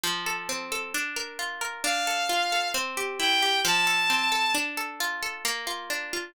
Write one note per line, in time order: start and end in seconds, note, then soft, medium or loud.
0.03 0.89 F3 loud
0.26 0.71 A4 loud
0.49 0.92 C4 medium
0.72 0.93 A4 loud
0.94 1.80 D4 loud
1.16 1.61 A#4 medium
1.39 1.82 F4 medium
1.61 1.83 A#4 medium
1.84 2.70 D4 loud
1.84 2.68 F5 medium
2.07 2.52 A4 medium
2.29 2.72 F4 medium
2.52 2.74 A4 medium
2.74 3.60 C4 loud
2.97 3.42 G4 medium
3.19 3.62 E4 medium
3.19 3.60 G5 medium
3.42 3.64 G4 medium
3.65 4.50 F3 loud
3.65 4.55 A5 medium
3.87 4.31 A4 loud
4.10 4.53 C4 medium
4.32 4.53 A4 medium
4.55 5.40 D4 loud
4.77 5.22 A4 medium
5.00 5.43 F4 loud
5.23 5.44 A4 medium
5.45 6.31 A#3 loud
5.67 6.13 F4 medium
5.90 6.33 D4 medium
6.13 6.34 F4 medium